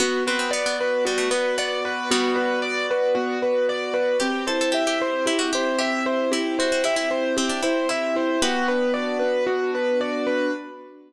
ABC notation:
X:1
M:4/4
L:1/16
Q:1/4=114
K:Bphr
V:1 name="Acoustic Grand Piano"
F2 B2 d2 B2 F2 B2 d2 B2 | F2 B2 d2 B2 F2 B2 d2 B2 | G2 c2 e2 c2 G2 c2 e2 c2 | G2 c2 e2 c2 G2 c2 e2 c2 |
F2 B2 d2 B2 F2 B2 d2 B2 |]
V:2 name="Pizzicato Strings"
B,2 C C B, B, z2 G, A, B,2 B,2 z2 | [G,B,]8 z8 | G2 A A G G z2 E F G2 G2 z2 | E2 F F E E z2 C D E2 E2 z2 |
[GB]8 z8 |]
V:3 name="Acoustic Grand Piano"
B,2 F2 d2 F2 B,2 F2 d2 F2 | B,2 F2 d2 F2 B,2 F2 d2 F2 | C2 E2 G2 E2 C2 E2 G2 E2 | C2 E2 G2 E2 C2 E2 G2 E2 |
B,2 D2 F2 D2 B,2 D2 F2 D2 |]